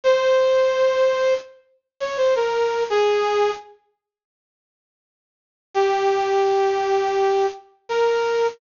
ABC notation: X:1
M:4/4
L:1/16
Q:1/4=84
K:Fm
V:1 name="Brass Section"
c8 z3 d c B3 | A4 z12 | G12 B4 |]